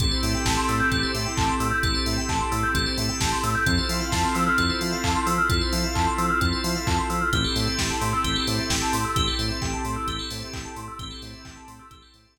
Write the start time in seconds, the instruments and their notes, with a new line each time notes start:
0.00 synth bass 1 A1, drawbar organ C4 E4 G4 A4, pad 5 (bowed) C4 E4 G4 A4, tubular bells A4, kick, closed hi-hat
0.11 tubular bells C5
0.23 synth bass 1 A2, tubular bells E5, open hi-hat
0.34 tubular bells G5
0.45 synth bass 1 A1, tubular bells A5, kick, snare
0.57 tubular bells C6
0.69 synth bass 1 A2, tubular bells E6, open hi-hat
0.80 tubular bells G6
0.91 synth bass 1 A1, tubular bells A4, kick, closed hi-hat
1.03 tubular bells C5
1.14 synth bass 1 A2, tubular bells E5, open hi-hat
1.26 tubular bells G5
1.37 synth bass 1 A1, tubular bells A5, kick, clap
1.49 tubular bells C6
1.60 synth bass 1 A2, tubular bells E6, open hi-hat
1.72 tubular bells G6
1.83 synth bass 1 A1, drawbar organ C4 E4 G4 A4, tubular bells A4, kick, closed hi-hat
1.95 tubular bells C5
2.06 synth bass 1 A2, tubular bells E5, open hi-hat
2.18 tubular bells G5
2.29 synth bass 1 A1, tubular bells A5, kick, clap
2.40 tubular bells C6
2.52 synth bass 1 A2, tubular bells E6, open hi-hat
2.63 tubular bells G6
2.75 synth bass 1 A1, tubular bells A4, kick, closed hi-hat
2.86 tubular bells C5
2.98 synth bass 1 A2, tubular bells E5, open hi-hat
3.09 tubular bells G5
3.21 synth bass 1 A1, tubular bells A5, kick, snare
3.32 tubular bells C6
3.43 synth bass 1 A2, tubular bells E6, open hi-hat
3.55 tubular bells G6
3.66 synth bass 1 F2, drawbar organ C4 E4 F4 A4, pad 5 (bowed) C4 E4 F4 A4, tubular bells A4, kick, closed hi-hat
3.78 tubular bells C5
3.89 synth bass 1 F3, tubular bells E5, open hi-hat
4.01 tubular bells F5
4.12 synth bass 1 F2, tubular bells A5, kick, snare
4.24 tubular bells C6
4.35 synth bass 1 F3, tubular bells E6, open hi-hat
4.47 tubular bells F6
4.58 synth bass 1 F2, tubular bells A4, kick, closed hi-hat
4.70 tubular bells C5
4.81 synth bass 1 F3, tubular bells E5, open hi-hat
4.92 tubular bells F5
5.04 synth bass 1 F2, tubular bells A5, kick, clap
5.15 tubular bells C6
5.27 synth bass 1 F3, tubular bells E6, open hi-hat
5.38 tubular bells F6
5.49 synth bass 1 F2, drawbar organ C4 E4 F4 A4, tubular bells A4, kick, closed hi-hat
5.61 tubular bells C5
5.73 synth bass 1 F3, tubular bells E5, open hi-hat
5.84 tubular bells F5
5.95 synth bass 1 F2, tubular bells A5, kick, clap
6.07 tubular bells C6
6.18 synth bass 1 F3, tubular bells E6, open hi-hat
6.30 tubular bells F6
6.41 synth bass 1 F2, tubular bells A4, kick, closed hi-hat
6.53 tubular bells C5
6.64 synth bass 1 F3, tubular bells E5, open hi-hat
6.75 tubular bells F5
6.87 synth bass 1 F2, tubular bells A5, kick, clap
6.98 tubular bells C6
7.10 synth bass 1 F3, tubular bells E6, open hi-hat
7.21 tubular bells F6
7.33 synth bass 1 A1, drawbar organ C4 E4 G4 A4, pad 5 (bowed) C4 E4 G4 A4, tubular bells G4, kick, closed hi-hat
7.44 tubular bells A4
7.56 synth bass 1 A2, tubular bells C5, open hi-hat
7.67 tubular bells E5
7.79 synth bass 1 A1, tubular bells G5, kick, snare
7.90 tubular bells A5
8.01 synth bass 1 A2, tubular bells C6, open hi-hat
8.13 tubular bells E6
8.24 synth bass 1 A1, tubular bells G4, kick, closed hi-hat
8.36 tubular bells A4
8.47 synth bass 1 A2, tubular bells C5, open hi-hat
8.59 tubular bells E5
8.70 synth bass 1 A1, tubular bells G5, kick, snare
8.82 tubular bells A5
8.93 synth bass 1 A2, tubular bells C6, open hi-hat
9.05 tubular bells E6
9.16 synth bass 1 A1, drawbar organ C4 E4 G4 A4, tubular bells G4, kick, closed hi-hat
9.27 tubular bells A4
9.39 synth bass 1 A2, tubular bells C5, open hi-hat
9.50 tubular bells E5
9.62 synth bass 1 A1, tubular bells G5, kick, clap
9.73 tubular bells A5
9.85 synth bass 1 A2, tubular bells C6, open hi-hat
9.96 tubular bells E6
10.08 synth bass 1 A1, tubular bells G4, kick, closed hi-hat
10.19 tubular bells A4
10.31 synth bass 1 A2, tubular bells C5, open hi-hat
10.42 tubular bells E5
10.53 synth bass 1 A1, tubular bells G5, kick, clap
10.65 tubular bells A5
10.76 synth bass 1 A2, tubular bells C6, open hi-hat
10.88 tubular bells E6
10.99 synth bass 1 A1, pad 5 (bowed) C4 E4 G4 A4, drawbar organ C4 E4 G4 A4, tubular bells G4, kick, closed hi-hat
11.11 tubular bells A4
11.22 synth bass 1 A2, tubular bells C5, open hi-hat
11.34 tubular bells E5
11.45 synth bass 1 A1, tubular bells G5, kick, clap
11.56 tubular bells A5
11.68 synth bass 1 A2, tubular bells C6, open hi-hat
11.79 tubular bells E6
11.91 synth bass 1 A1, drawbar organ C4 E4 G4 A4, tubular bells G4, kick, closed hi-hat
12.02 tubular bells A4
12.14 synth bass 1 A2, tubular bells C5, open hi-hat
12.25 tubular bells E5
12.37 synth bass 1 A1, tubular bells G5, kick, snare